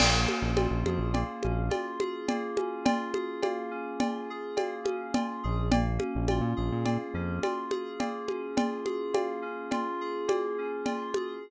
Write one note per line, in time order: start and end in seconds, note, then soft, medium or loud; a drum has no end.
0.00 0.27 A#1 medium
0.00 1.14 A#3 medium
0.00 crash loud
0.00 cowbell medium
0.00 low conga medium
0.28 1.43 C#4 medium
0.28 high conga medium
0.42 0.68 A#1 medium
0.56 1.69 F4 medium
0.56 cowbell medium
0.56 high conga medium
0.71 0.84 A#1 medium
0.85 0.99 F2 medium
0.85 2.00 G#4 medium
0.85 high conga medium
0.99 1.24 A#1 medium
1.14 2.28 A#3 medium
1.14 cowbell medium
1.14 low conga medium
1.43 1.70 A#1 medium
1.43 2.57 C#4 medium
1.43 high conga medium
1.70 2.85 F4 medium
1.70 cowbell medium
1.70 high conga medium
2.00 3.14 G#4 medium
2.00 high conga medium
2.28 3.42 A#3 medium
2.28 cowbell medium
2.28 low conga medium
2.57 3.70 C#4 medium
2.57 high conga medium
2.85 4.00 F4 medium
2.85 cowbell medium
2.85 low conga medium
3.14 4.29 G#4 medium
3.14 high conga medium
3.43 4.56 A#3 medium
3.43 cowbell medium
3.43 high conga medium
3.71 4.84 C#4 medium
4.00 5.14 F4 medium
4.00 cowbell medium
4.00 low conga medium
4.30 5.43 G#4 medium
4.56 5.65 A#3 medium
4.56 cowbell medium
4.56 high conga medium
4.84 5.65 C#4 medium
4.84 high conga medium
5.14 5.69 F4 medium
5.14 cowbell medium
5.14 low conga medium
5.43 5.99 A#1 medium
5.43 5.71 G#4 medium
5.72 6.84 A#3 medium
5.72 cowbell medium
5.72 low conga loud
5.99 7.14 C#4 medium
5.99 high conga medium
6.15 6.41 A#1 medium
6.28 7.43 F4 medium
6.28 cowbell medium
6.28 high conga medium
6.41 6.54 A#2 medium
6.56 6.71 A#1 medium
6.56 7.71 G#4 medium
6.72 6.98 A#2 medium
6.85 7.99 A#3 medium
6.85 cowbell medium
6.85 low conga medium
7.14 7.40 F2 medium
7.14 8.27 C#4 medium
7.43 8.57 F4 medium
7.43 cowbell medium
7.43 high conga medium
7.71 8.85 G#4 medium
7.71 high conga medium
8.00 9.13 A#3 medium
8.00 cowbell medium
8.00 low conga medium
8.27 9.41 C#4 medium
8.27 high conga medium
8.57 9.72 F4 medium
8.57 cowbell medium
8.57 low conga medium
8.85 10.00 G#4 medium
8.85 high conga medium
9.13 10.27 A#3 medium
9.13 cowbell medium
9.13 high conga medium
9.42 10.58 C#4 medium
9.71 10.85 F4 medium
9.71 cowbell medium
9.71 low conga medium
10.01 11.15 G#4 medium
10.28 11.36 A#3 medium
10.28 cowbell medium
10.28 high conga medium
10.58 11.40 C#4 medium
10.85 11.39 F4 medium
10.85 cowbell medium
10.85 low conga medium
11.14 11.43 G#4 medium
11.14 high conga medium